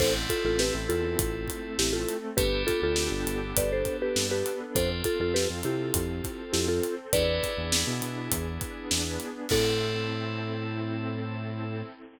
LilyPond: <<
  \new Staff \with { instrumentName = "Marimba" } { \time 4/4 \key a \minor \tempo 4 = 101 <a' c''>16 r16 <f' a'>16 <f' a'>16 <g' b'>16 r16 <f' a'>4. <e' g'>16 <f' a'>8 r16 | <g' b'>8 <f' a'>16 <f' a'>4~ <f' a'>16 <b' d''>16 <a' c''>8 <g' b'>8 <g' b'>8 r16 | <a' c''>16 r16 <f' a'>16 <f' a'>16 <g' b'>16 r16 <e' g'>4. <e' g'>16 <f' a'>8 r16 | <b' d''>4. r2 r8 |
a'1 | }
  \new Staff \with { instrumentName = "Electric Piano 2" } { \time 4/4 \key a \minor <c' e' a'>1 | <b d' g' a'>1 | <c' f' a'>1 | <b d' e' gis'>1 |
<c' e' a'>1 | }
  \new Staff \with { instrumentName = "Synth Bass 1" } { \clef bass \time 4/4 \key a \minor a,,8. a,,8 a,,16 e,8 a,,4 a,,4 | g,,8. d,8 g,,16 g,,8 g,,4 g,4 | f,8. f,8 f,16 c8 f,4 f,4 | e,8. e,8 b,16 b,8 e,4 e,4 |
a,1 | }
  \new Staff \with { instrumentName = "Pad 5 (bowed)" } { \time 4/4 \key a \minor <c' e' a'>2 <a c' a'>2 | <b d' g' a'>2 <b d' a' b'>2 | <c' f' a'>2 <c' a' c''>2 | <b d' e' gis'>2 <b d' gis' b'>2 |
<c' e' a'>1 | }
  \new DrumStaff \with { instrumentName = "Drums" } \drummode { \time 4/4 <cymc bd>8 <hh bd>8 sn8 hh8 <hh bd>8 <hh bd>8 sn8 hh8 | <hh bd>8 <hh bd>8 sn8 hh8 <hh bd>8 <hh bd>8 sn8 hh8 | <hh bd>8 <hh bd>8 sn8 hh8 <hh bd>8 <hh bd>8 sn8 hh8 | <hh bd>8 <hh bd>8 sn8 hh8 <hh bd>8 <hh bd>8 sn8 hh8 |
<cymc bd>4 r4 r4 r4 | }
>>